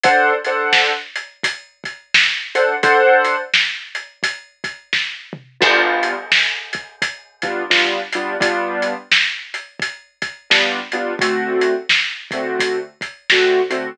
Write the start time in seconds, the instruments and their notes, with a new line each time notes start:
0.03 acoustic grand piano D4 A4 C5 F#5, kick, closed hi-hat
0.44 acoustic grand piano D4 A4 C5 F#5, closed hi-hat
0.73 snare
1.15 closed hi-hat
1.43 kick, closed hi-hat
1.84 kick, closed hi-hat
2.14 snare
2.55 acoustic grand piano D4 A4 C5 F#5, closed hi-hat
2.83 acoustic grand piano D4 A4 C5 F#5, kick, closed hi-hat
3.24 closed hi-hat
3.53 snare
3.95 closed hi-hat
4.23 kick, closed hi-hat
4.64 kick, closed hi-hat
4.93 kick, snare
5.33 mid tom
5.60 acoustic grand piano G3 B3 D4 F4, kick, crash
6.03 closed hi-hat
6.32 snare
6.73 kick, closed hi-hat
7.02 kick, closed hi-hat
7.42 acoustic grand piano G3 B3 D4 F4, kick, closed hi-hat
7.70 acoustic grand piano G3 B3 D4 F4, snare
8.12 acoustic grand piano G3 B3 D4 F4, closed hi-hat
8.40 acoustic grand piano G3 B3 D4 F4, kick, closed hi-hat
8.82 closed hi-hat
9.11 snare
9.54 closed hi-hat
9.80 kick, closed hi-hat
10.22 kick, closed hi-hat
10.50 acoustic grand piano G3 B3 D4 F4, snare
10.92 acoustic grand piano G3 B3 D4 F4, closed hi-hat
11.19 acoustic grand piano D3 A3 C4 F#4, kick, closed hi-hat
11.61 closed hi-hat
11.89 snare
12.31 acoustic grand piano D3 A3 C4 F#4, kick, closed hi-hat
12.59 kick, closed hi-hat
13.01 kick, closed hi-hat
13.30 acoustic grand piano D3 A3 C4 F#4, snare
13.70 acoustic grand piano D3 A3 C4 F#4, closed hi-hat